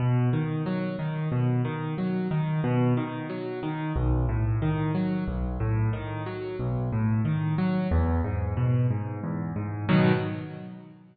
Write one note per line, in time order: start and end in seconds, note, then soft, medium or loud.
0.00 0.29 B2 medium
0.33 0.63 D#3 medium
0.66 0.96 F#3 medium
0.99 1.29 D#3 medium
1.32 1.62 B2 medium
1.65 1.94 D#3 medium
1.98 2.28 F#3 medium
2.31 2.61 D#3 medium
2.64 2.94 B2 medium
2.97 3.27 D#3 medium
3.30 3.59 F#3 medium
3.63 3.92 D#3 medium
3.96 4.25 B1 medium
4.29 4.58 A2 medium
4.62 4.92 D#3 medium
4.95 5.24 F#3 medium
5.27 5.57 B1 medium
5.60 5.90 A2 medium
5.93 6.23 D#3 medium
6.26 6.56 F#3 medium
6.59 6.89 B1 medium
6.92 7.22 A2 medium
7.25 7.55 D#3 medium
7.58 7.88 F#3 medium
7.91 8.21 E2 medium
8.24 8.54 G#2 medium
8.57 8.87 B2 medium
8.91 9.20 G#2 medium
9.23 9.53 E2 medium
9.56 9.86 G#2 medium
9.89 10.12 B2 loud
9.89 10.12 D#3 medium
9.89 10.12 F#3 medium